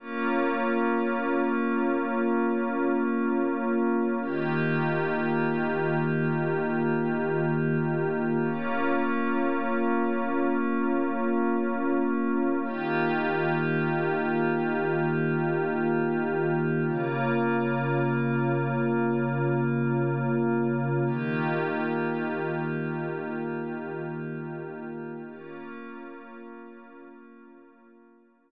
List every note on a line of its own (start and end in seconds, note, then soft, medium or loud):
0.00 4.17 A#3 loud
0.00 4.17 C#4 loud
0.00 4.17 F4 loud
4.21 8.38 D#3 loud
4.21 8.38 A#3 loud
4.21 8.38 F4 medium
4.21 8.38 G4 loud
8.42 12.59 A#3 loud
8.42 12.59 C#4 loud
8.42 12.59 F4 loud
12.63 16.80 D#3 loud
12.63 16.80 A#3 medium
12.63 16.80 F4 loud
12.63 16.80 G4 loud
16.84 21.00 C#3 loud
16.84 21.00 A#3 loud
16.84 21.00 F4 loud
21.05 25.22 D#3 loud
21.05 25.22 A#3 loud
21.05 25.22 F4 loud
21.05 25.22 G4 medium
25.26 28.51 A#3 medium
25.26 28.51 C#4 medium
25.26 28.51 F4 loud